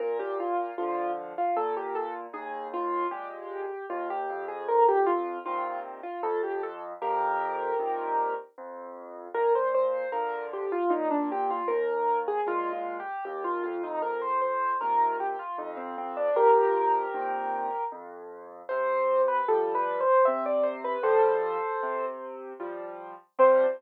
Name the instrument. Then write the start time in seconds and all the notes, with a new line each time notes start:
acoustic grand piano
0.00 A#2 A#4
0.19 G4
0.40 F4
0.78 D3 F3 F4
1.38 F4
1.56 A#2 A4
1.77 G4
1.95 A4
2.33 D#2 G#4
2.74 F4
3.11 A#2 G#3 G4
3.90 D#2 F4
4.10 G4
4.30 F2
4.48 G#4
4.68 A#4
4.88 G4
5.06 F4
5.46 A#2 C3 D#3 F4
6.03 F4
6.23 F2 A4
6.43 G4
6.63 A4
7.01 F2 G4 A#4
7.79 A#2 C3 D#3
8.58 F2
9.34 A#2 A#4
9.55 C5
9.75 C5
10.12 D3 F3 A#4
10.53 G4
10.72 F4
10.90 A#2 D#4
11.11 D4
11.32 G4
11.50 F4
11.68 D#2 A#4
12.28 G#4
12.46 A#2 G#3 F4
12.73 F4
13.00 G4
13.25 D#2 G4
13.44 F4
13.63 F2 F4
13.83 D#4
14.02 A#4
14.22 C5
14.41 C5
14.81 A#2 C3 D#3 A#4
15.20 G4
15.39 F4
15.58 F2 D#4
15.77 C4
15.98 C4
16.17 D4
16.36 F2 G4 A#4
17.14 A#2 C3 D#3
17.92 F2
18.69 C3 C5
19.28 B4
19.48 F3 G3 A4
19.75 B4
20.00 C5
20.25 C3 E5
20.46 D5
20.63 C5
20.84 B4
21.03 F3 G3 A4 C5
21.83 C3
22.60 F3 G3
23.39 C3 F3 G3 C5